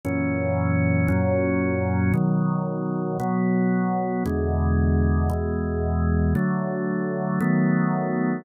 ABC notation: X:1
M:4/4
L:1/8
Q:1/4=57
K:A
V:1 name="Drawbar Organ"
[F,,^A,,E,C]2 [F,,A,,F,C]2 [B,,^D,F,]2 [B,,F,B,]2 | [E,,B,,D,G,]2 [E,,B,,E,G,]2 [D,F,A,]2 [^D,F,A,B,]2 |]